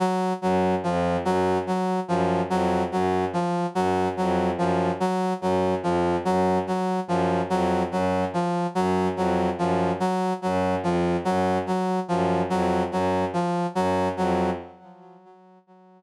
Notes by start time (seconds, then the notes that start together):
0.00 F#3
0.42 F#2 F#3
0.84 F2 F3
1.24 F#2 F#3
1.67 F#3
2.08 F#2 F3
2.50 F2 F#3
2.91 F#2 F#3
3.33 F3
3.75 F#2 F#3
4.17 F2 F#3
4.56 F#2 F3
5.00 F#3
5.41 F#2 F#3
5.82 F2 F3
6.25 F#2 F#3
6.67 F#3
7.07 F#2 F3
7.50 F2 F#3
7.91 F#2 F#3
8.34 F3
8.75 F#2 F#3
9.16 F2 F#3
9.58 F#2 F3
10.00 F#3
10.42 F#2 F#3
10.83 F2 F3
11.25 F#2 F#3
11.66 F#3
12.08 F#2 F3
12.50 F2 F#3
12.91 F#2 F#3
13.33 F3
13.75 F#2 F#3
14.17 F2 F#3